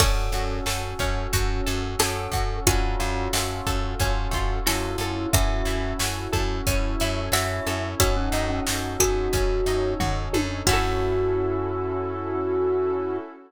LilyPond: <<
  \new Staff \with { instrumentName = "Glockenspiel" } { \time 4/4 \key fis \minor \tempo 4 = 90 a'4 r2 a'4 | eis'4 r2 e'4 | e''4 r2 e''4 | fis'16 cis'8 cis'16 r8 fis'4. r4 |
fis'1 | }
  \new Staff \with { instrumentName = "Harpsichord" } { \time 4/4 \key fis \minor <d' fis'>2. a'4 | <d' fis'>2. a'4 | <fis' a'>2. e''4 | <fis' a'>4. gis'4. r4 |
fis'1 | }
  \new Staff \with { instrumentName = "Electric Piano 1" } { \time 4/4 \key fis \minor <cis' fis' a'>4 <cis' fis' a'>4 <cis' fis' a'>4 <cis' fis' a'>4 | <cis' eis' fis' a'>4 <cis' eis' fis' a'>4 <cis' eis' fis' a'>4 <cis' eis' fis' a'>4 | <cis' e' fis' a'>1 | <cis' dis' fis' a'>1 |
<cis' e' fis' a'>1 | }
  \new Staff \with { instrumentName = "Pizzicato Strings" } { \time 4/4 \key fis \minor cis'8 fis'8 a'8 cis'8 fis'8 a'8 cis'8 fis'8 | cis'8 eis'8 fis'8 a'8 cis'8 eis'8 fis'8 a'8 | cis'8 e'8 fis'8 a'8 cis'8 e'8 fis'8 a'8 | cis'8 dis'8 fis'8 a'8 cis'8 dis'8 fis'8 a'8 |
<cis' e' fis' a'>1 | }
  \new Staff \with { instrumentName = "Electric Bass (finger)" } { \clef bass \time 4/4 \key fis \minor fis,8 fis,8 fis,8 fis,8 fis,8 fis,8 fis,8 fis,8 | fis,8 fis,8 fis,8 fis,8 fis,8 fis,8 fis,8 fis,8 | fis,8 fis,8 fis,8 fis,8 fis,8 fis,8 fis,8 fis,8 | fis,8 fis,8 fis,8 fis,8 fis,8 fis,8 fis,8 fis,8 |
fis,1 | }
  \new Staff \with { instrumentName = "Pad 5 (bowed)" } { \time 4/4 \key fis \minor <cis' fis' a'>1 | <cis' eis' fis' a'>1 | <cis' e' fis' a'>2 <cis' e' a' cis''>2 | <cis' dis' fis' a'>2 <cis' dis' a' cis''>2 |
<cis' e' fis' a'>1 | }
  \new DrumStaff \with { instrumentName = "Drums" } \drummode { \time 4/4 <cymc bd>8 hh8 sn8 <hh bd>8 <hh bd>8 hh8 sn8 <hh bd>8 | <hh bd>8 hh8 sn8 <hh bd>8 <hh bd>8 <hh bd>8 sn8 hh8 | <hh bd>8 hh8 sn8 <hh bd>8 <hh bd>8 hh8 sn8 hh8 | <hh bd>8 hh8 sn8 <hh bd>8 <hh bd>8 hh8 <bd tomfh>8 tommh8 |
<cymc bd>4 r4 r4 r4 | }
>>